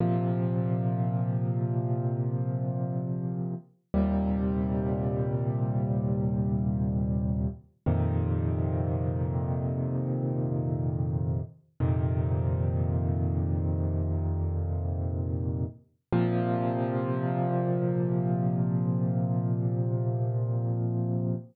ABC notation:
X:1
M:4/4
L:1/8
Q:1/4=61
K:Bb
V:1 name="Acoustic Grand Piano" clef=bass
[B,,C,F,]8 | [E,,B,,C,G,]8 | [F,,B,,C,E,]8 | "^rit." [F,,B,,C,E,]8 |
[B,,C,F,]8 |]